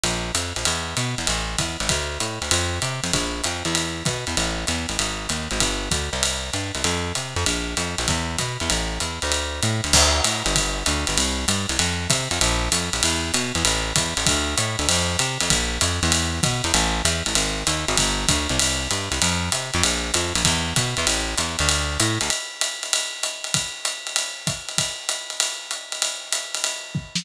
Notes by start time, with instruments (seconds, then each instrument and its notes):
0.04 electric bass (finger) A#1, ride
0.35 electric bass (finger) F2, hi-hat pedal, ride
0.56 electric bass (finger) A#1, ride
0.65 electric bass (finger) E2, ride
0.97 electric bass (finger) B2, hi-hat pedal, ride
1.18 electric bass (finger) E2, ride
1.27 electric bass (finger) A1, ride
1.58 electric bass (finger) E2, kick, hi-hat pedal, ride
1.80 electric bass (finger) A1, ride
1.89 electric bass (finger) D2, kick, ride
2.20 electric bass (finger) A2, hi-hat pedal, ride
2.42 electric bass (finger) D2, ride
2.51 electric bass (finger) F2, ride
2.82 electric bass (finger) C3, hi-hat pedal, ride
3.04 electric bass (finger) F2, ride
3.13 electric bass (finger) A#1, kick, ride
3.44 electric bass (finger) F2, hi-hat pedal, ride
3.65 electric bass (finger) E2, ride
3.75 ride
4.05 electric bass (finger) B2, kick, hi-hat pedal, ride
4.27 electric bass (finger) E2, ride
4.37 electric bass (finger) A1, ride
4.67 electric bass (finger) E2, hi-hat pedal, ride
4.89 electric bass (finger) A1, ride
4.99 electric bass (finger) G#1, ride
5.29 electric bass (finger) D#2, hi-hat pedal, ride
5.51 electric bass (finger) G#1, ride
5.60 electric bass (finger) G1, kick, ride
5.91 electric bass (finger) D2, kick, hi-hat pedal, ride
6.13 electric bass (finger) C2, ride
6.23 ride
6.53 electric bass (finger) G2, hi-hat pedal, ride
6.75 electric bass (finger) C2, ride
6.84 electric bass (finger) F2, ride
7.15 electric bass (finger) C3, hi-hat pedal, ride
7.36 electric bass (finger) F2, ride
7.46 electric bass (finger) A#1, ride
7.77 electric bass (finger) F2, hi-hat pedal, ride
7.98 electric bass (finger) A#1, ride
8.08 electric bass (finger) E2, kick, ride
8.38 electric bass (finger) B2, kick, hi-hat pedal, ride
8.60 electric bass (finger) E2, ride
8.70 electric bass (finger) A1, ride
9.00 electric bass (finger) E2, hi-hat pedal, ride
9.22 electric bass (finger) D2, ride
9.32 ride
9.62 electric bass (finger) A2, hi-hat pedal, ride
9.84 electric bass (finger) D2, ride
9.93 electric bass (finger) D2, kick, crash, ride
10.24 electric bass (finger) A2, hi-hat pedal, ride
10.46 electric bass (finger) G1, ride
10.56 kick, ride
10.86 electric bass (finger) D2, hi-hat pedal, ride
11.07 electric bass (finger) G1, ride
11.18 electric bass (finger) C2, ride
11.48 electric bass (finger) G2, hi-hat pedal, ride
11.69 electric bass (finger) C2, ride
11.79 electric bass (finger) F2, ride
12.10 electric bass (finger) C3, kick, hi-hat pedal, ride
12.31 electric bass (finger) F2, ride
12.41 electric bass (finger) A#1, ride
12.72 electric bass (finger) F2, hi-hat pedal, ride
12.93 electric bass (finger) A#1, ride
13.03 electric bass (finger) E2, ride
13.34 electric bass (finger) B2, hi-hat pedal, ride
13.55 electric bass (finger) E2, ride
13.65 electric bass (finger) A1, ride
13.96 electric bass (finger) E2, kick, hi-hat pedal, ride
14.17 electric bass (finger) A1, ride
14.26 electric bass (finger) D2, kick, ride
14.58 electric bass (finger) A2, hi-hat pedal, ride
14.79 electric bass (finger) D2, ride
14.89 electric bass (finger) F2, ride
15.19 electric bass (finger) C3, hi-hat pedal, ride
15.40 electric bass (finger) F2, ride
15.50 electric bass (finger) A#1, kick, ride
15.81 electric bass (finger) F2, hi-hat pedal, ride
16.03 electric bass (finger) E2, ride
16.12 ride
16.43 electric bass (finger) B2, kick, hi-hat pedal, ride
16.64 electric bass (finger) E2, ride
16.74 electric bass (finger) A1, ride
17.05 electric bass (finger) E2, hi-hat pedal, ride
17.26 electric bass (finger) A1, ride
17.35 electric bass (finger) G#1, ride
17.67 electric bass (finger) D#2, hi-hat pedal, ride
17.88 electric bass (finger) G#1, ride
17.97 electric bass (finger) G1, kick, ride
18.28 electric bass (finger) D2, kick, hi-hat pedal, ride
18.49 electric bass (finger) C2, ride
18.59 ride
18.91 electric bass (finger) G2, hi-hat pedal, ride
19.12 electric bass (finger) C2, ride
19.22 electric bass (finger) F2, ride
19.52 electric bass (finger) C3, hi-hat pedal, ride
19.74 electric bass (finger) F2, ride
19.83 electric bass (finger) A#1, ride
20.14 electric bass (finger) F2, hi-hat pedal, ride
20.35 electric bass (finger) A#1, ride
20.45 electric bass (finger) E2, kick, ride
20.76 electric bass (finger) B2, kick, hi-hat pedal, ride
20.97 electric bass (finger) E2, ride
21.07 electric bass (finger) A1, ride
21.38 electric bass (finger) E2, hi-hat pedal, ride
21.59 electric bass (finger) D2, ride
21.69 ride
22.00 electric bass (finger) A2, hi-hat pedal, ride
22.21 electric bass (finger) D2, ride
22.30 ride
22.61 hi-hat pedal, ride
22.83 ride
22.93 ride
23.23 hi-hat pedal, ride
23.44 ride
23.54 kick, ride
23.85 hi-hat pedal, ride
24.07 ride
24.16 ride
24.47 kick, hi-hat pedal, ride
24.69 ride
24.78 kick, ride
25.09 hi-hat pedal, ride
25.30 ride
25.40 ride
25.71 hi-hat pedal, ride
25.92 ride
26.02 ride
26.32 hi-hat pedal, ride
26.54 ride
26.64 ride
26.95 kick
27.15 snare